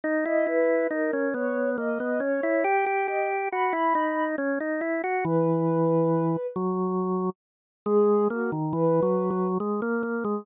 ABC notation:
X:1
M:3/4
L:1/16
Q:1/4=69
K:G#m
V:1 name="Ocarina"
z d B2 A2 c2 d2 c2 | =g2 d z b4 z4 | B6 z6 | G2 F z B4 z4 |]
V:2 name="Drawbar Organ"
D E E2 D C B,2 A, B, C E | =G G G2 F E D2 C D E F | E,6 F,4 z2 | G,2 A, D, (3E,2 F,2 F,2 G, A, A, G, |]